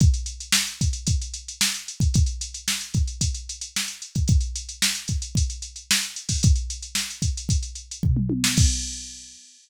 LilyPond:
\new DrumStaff \drummode { \time 4/4 \tempo 4 = 112 <hh bd>16 hh16 hh16 hh16 sn16 hh16 <hh bd>16 hh16 <hh bd>16 hh16 hh16 hh16 sn16 hh16 hh16 <hh bd>16 | <hh bd>16 hh16 hh16 hh16 sn16 hh16 <hh bd>16 hh16 <hh bd>16 hh16 hh16 hh16 sn16 hh16 hh16 <hh bd>16 | <hh bd>16 hh16 hh16 hh16 sn16 hh16 <hh bd>16 hh16 <hh bd>16 hh16 hh16 hh16 sn16 hh16 hh16 <hho bd>16 | <hh bd>16 hh16 hh16 hh16 sn16 hh16 <hh bd>16 hh16 <hh bd>16 hh16 hh16 hh16 <bd tomfh>16 toml16 tommh16 sn16 |
<cymc bd>4 r4 r4 r4 | }